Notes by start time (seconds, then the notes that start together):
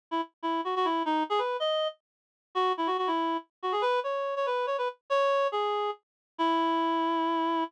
0.11 E4
0.43 E4
0.65 F#4
0.76 F#4
0.85 E4
1.05 D#4
1.30 G#4
1.39 B4
1.60 D#5
2.55 F#4
2.77 E4
2.87 F#4
2.98 F#4
3.07 E4
3.63 F#4
3.72 G#4
3.82 B4
4.04 C#5
4.36 C#5
4.46 B4
4.67 C#5
4.78 B4
5.10 C#5
5.52 G#4
6.38 E4